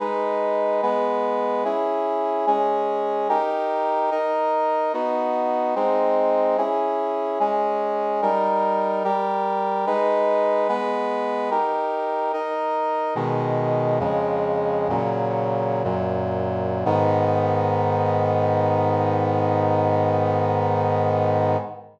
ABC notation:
X:1
M:4/4
L:1/8
Q:1/4=73
K:G#m
V:1 name="Brass Section"
[G,DB]2 [G,B,B]2 [CEG]2 [G,CG]2 | [D=GA]2 [DAd]2 [B,DF]2 [^G,^B,D]2 | [CEG]2 [G,CG]2 [=G,DA]2 [G,=GA]2 | [G,DB]2 [G,B,B]2 [D=GA]2 [DAd]2 |
"^rit." [B,,D,G,]2 [^E,,C,G,]2 [A,,C,F,]2 [F,,A,,F,]2 | [G,,D,B,]8 |]